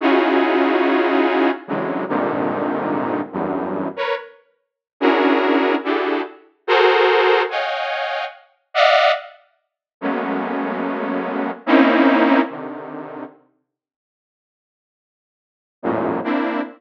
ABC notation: X:1
M:5/4
L:1/16
Q:1/4=72
K:none
V:1 name="Lead 2 (sawtooth)"
[_D_E=EF_G_A]8 [C,_D,=D,E,_G,_A,]2 [=G,,_A,,_B,,C,D,_E,]6 [=E,,_G,,=G,,]3 [_B=B_d] | z4 [_D=DE_G_A_B]4 [DEG=GA=A]2 z2 [_G_A=ABc]4 [_d_ef_g=g_a]4 | z2 [d_e=ef_g]2 z4 [_G,_A,=A,_B,=B,_D]8 [_B,CD_E=E]4 | [C,D,_E,]4 z12 [=E,,_G,,_A,,=A,,_B,,]2 [_B,CDE]2 |]